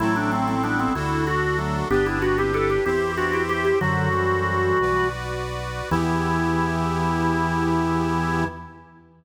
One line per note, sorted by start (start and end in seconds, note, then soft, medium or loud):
0.00 0.88 A1 medium
0.00 0.55 F#3 medium
0.00 0.55 A3 medium
0.00 0.93 C4 loud
0.00 0.15 E4 loud
0.00 0.93 E4 loud
0.00 0.93 A4 medium
0.16 0.31 D4 medium
0.32 0.47 C4 medium
0.48 0.63 C4 medium
0.63 0.94 G3 medium
0.63 0.94 B3 medium
0.63 0.78 D4 medium
0.79 0.94 C4 medium
0.95 1.83 D2 medium
0.95 1.88 D4 medium
0.95 1.25 E4 medium
0.95 1.88 F#4 loud
0.95 1.88 A4 loud
1.27 1.57 F#4 loud
1.59 1.85 F#3 medium
1.59 1.85 A3 medium
1.90 2.78 G1 loud
1.90 2.19 B3 medium
1.90 2.19 D4 medium
1.90 2.84 D4 loud
1.90 2.06 G4 loud
1.90 2.84 G4 medium
1.90 2.84 B4 medium
2.06 2.21 E4 medium
2.22 2.37 D4 medium
2.22 2.37 F#4 medium
2.38 2.54 C4 medium
2.38 2.54 E4 medium
2.38 2.53 G4 medium
2.54 2.81 E4 medium
2.54 2.81 G4 medium
2.54 2.69 A4 medium
2.70 2.85 G4 medium
2.86 3.73 E2 medium
2.86 3.01 C4 medium
2.86 3.01 E4 medium
2.86 3.79 E4 medium
2.86 3.79 G4 loud
2.86 3.12 G4 loud
2.86 3.79 C5 loud
3.17 3.32 D4 medium
3.17 3.32 F#4 medium
3.17 3.43 F#4 medium
3.33 3.48 E4 medium
3.33 3.48 G4 medium
3.49 3.64 E4 medium
3.49 3.64 G4 medium
3.49 3.77 G4 loud
3.65 3.80 E4 medium
3.65 3.80 G4 medium
3.81 4.73 F#2 medium
3.81 4.09 D3 medium
3.81 4.09 F#3 medium
3.81 5.08 F#4 loud
3.81 4.79 F#4 medium
3.81 4.79 A4 medium
3.81 4.79 C5 medium
4.13 5.10 E3 medium
4.13 5.10 G3 medium
4.81 5.82 B1 medium
4.81 5.90 F#4 loud
4.81 5.90 B4 loud
4.81 5.90 D5 medium
5.91 8.45 E2 loud
5.91 8.45 E3 loud
5.91 8.44 B3 medium
5.91 8.44 E4 loud
5.91 8.45 E4 loud
5.91 8.44 G4 loud